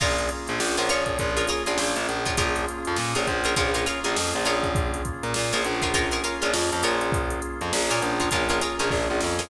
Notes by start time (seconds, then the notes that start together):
0.00 A#1 A#3 C#4 F4 G#4 A#4 C#5, kick, crash
0.18 closed hi-hat
0.29 closed hi-hat
0.47 A#1, snare, closed hi-hat
0.60 A#1, snare
0.77 A#1 F4 G#4 A#4 C#5, closed hi-hat
0.89 A#1 F4 G#4 A#4 C#5, closed hi-hat
1.06 kick, closed hi-hat
1.19 A#1 A#3 C#4 F4 G#4, kick, closed hi-hat
1.37 F4 G#4 A#4 C#5, closed hi-hat
1.47 F4 G#4 A#4 C#5, snare, closed hi-hat
1.66 A#1 F4 G#4 A#4 C#5, snare, closed hi-hat
1.78 A#1, snare
1.96 A#1, closed hi-hat
2.09 A#1, closed hi-hat
2.25 F4 G#4 A#4 C#5, kick, closed hi-hat
2.37 A#1 A#3 C#4 F4 G#4 A#4 C#5, kick, closed hi-hat
2.55 snare, closed hi-hat
2.68 closed hi-hat
2.85 F2, closed hi-hat
2.96 A#2, snare
3.15 A#1 F4 G#4 A#4 C#5, closed hi-hat
3.27 A#1, kick, closed hi-hat
3.44 F4 G#4 A#4 C#5, closed hi-hat
3.56 A#1 A#3 C#4 F4 G#4 A#4 C#5, kick, closed hi-hat
3.74 F4 G#4 A#4 C#5, closed hi-hat
3.86 F4 G#4 A#4 C#5, snare, closed hi-hat
4.04 A#1 F4 G#4 A#4 C#5, closed hi-hat
4.16 F2, snare
4.33 A#1, closed hi-hat
4.45 A#1 F4 G#4 A#4 C#5, closed hi-hat
4.63 kick, closed hi-hat
4.75 A#3 C#4 F4 G#4, kick, closed hi-hat
4.94 closed hi-hat
5.05 kick, closed hi-hat
5.23 A#2, closed hi-hat
5.34 A#2, snare
5.52 A#1 F4 G#4 A#4 C#5, snare, closed hi-hat
5.64 A#1 A#3 C#4 F4 G#4, closed hi-hat
5.82 F4 G#4 A#4 C#5, kick, snare, closed hi-hat
5.94 F4 G#4 A#4 C#5, kick, closed hi-hat
6.11 F4 G#4 A#4 C#5, snare, closed hi-hat
6.24 F4 G#4 A#4 C#5, closed hi-hat
6.42 A#1 F4 G#4 A#4 C#5, closed hi-hat
6.54 F2, snare
6.72 F2, closed hi-hat
6.83 A#1 F4 G#4 A#4 C#5, closed hi-hat
7.01 closed hi-hat
7.12 A#3 C#4 F4 G#4, kick, closed hi-hat
7.30 closed hi-hat
7.42 closed hi-hat
7.61 F2, closed hi-hat
7.73 A#1, snare
7.90 A#2 F4 G#4 A#4 C#5, closed hi-hat
8.02 A#1, closed hi-hat
8.20 F4 G#4 A#4 C#5, kick, closed hi-hat
8.31 A#1 A#3 C#4 F4 G#4 A#4 C#5, kick, closed hi-hat
8.49 F4 G#4 A#4 C#5, closed hi-hat
8.61 F4 G#4 A#4 C#5, closed hi-hat
8.79 A#1 F4 G#4 A#4 C#5, closed hi-hat
8.90 A#1, kick, snare
9.10 A#1
9.21 F2, snare
9.39 F4 G#4 A#4 C#5, snare